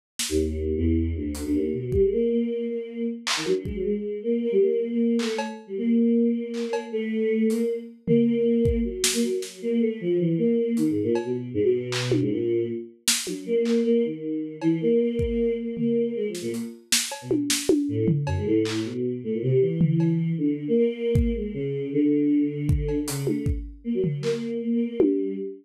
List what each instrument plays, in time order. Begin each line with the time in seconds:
0.19 snare
0.29 choir aahs D#2
0.77 choir aahs E2
1.16 choir aahs D2
1.35 closed hi-hat
1.44 choir aahs D2
1.53 choir aahs D#2
1.73 choir aahs B2
1.92 choir aahs G3, kick
2.02 choir aahs G#3
2.12 choir aahs A#3
2.31 choir aahs A#3
2.70 choir aahs A#3
3.27 clap
3.37 choir aahs D#3
3.46 choir aahs F#3, high tom
3.65 choir aahs G#3, kick
3.75 choir aahs F#3
3.84 choir aahs G#3
4.23 choir aahs A#3
4.42 choir aahs A#3
4.52 choir aahs G3
4.61 choir aahs A#3
4.90 choir aahs A#3
5.19 choir aahs A3, clap
5.38 cowbell
5.67 choir aahs G3
5.77 choir aahs A#3
6.54 clap
6.73 cowbell
6.92 choir aahs A3
7.50 choir aahs A#3, closed hi-hat
7.59 choir aahs A#3
8.07 choir aahs A#3, floor tom
8.65 kick
8.85 choir aahs F#3
9.04 snare
9.13 choir aahs A#3
9.23 choir aahs F#3
9.42 snare
9.62 choir aahs A#3
9.81 choir aahs A3
10.01 choir aahs F3
10.19 choir aahs E3
10.38 choir aahs A#3
10.77 choir aahs D#3, closed hi-hat
10.90 choir aahs G#2
11.02 choir aahs A#2
11.15 cowbell
11.24 choir aahs B2
11.54 choir aahs G#2
11.64 choir aahs B2
11.92 clap
12.12 high tom
12.20 choir aahs G#2
12.31 choir aahs A#2
13.08 snare
13.27 choir aahs F#3, high tom
13.46 choir aahs A#3
13.65 clap
13.84 choir aahs A#3
14.04 choir aahs D#3
14.61 choir aahs E3, cowbell
14.81 choir aahs A#3
14.99 choir aahs A#3
15.19 kick
15.58 choir aahs A#3
15.77 choir aahs A#3, floor tom
16.15 choir aahs G#3
16.28 choir aahs F3
16.35 snare
16.42 choir aahs A#2
16.54 closed hi-hat
16.92 snare
17.12 cowbell
17.22 choir aahs B2
17.31 high tom
17.50 snare
17.69 high tom
17.88 choir aahs A2
18.08 floor tom
18.26 choir aahs F#2, cowbell
18.37 choir aahs G#2
18.46 choir aahs A2
18.65 clap
18.85 choir aahs B2
19.24 choir aahs A2
19.33 choir aahs A#2
19.42 choir aahs C3
19.61 choir aahs E3
19.81 floor tom
20.00 cowbell
20.38 choir aahs D3
20.68 choir aahs A#3
20.77 choir aahs A#3
21.15 kick
21.35 choir aahs G#3
21.54 choir aahs C#3
21.93 choir aahs D3
22.69 kick
22.88 cowbell
23.07 choir aahs C#3, closed hi-hat
23.27 choir aahs A3, high tom
23.46 kick
23.84 choir aahs A#3
23.94 choir aahs F#3
24.04 floor tom
24.22 choir aahs A#3, clap
24.62 choir aahs A#3
24.74 choir aahs A#3
24.87 choir aahs A#3
24.99 choir aahs G3, high tom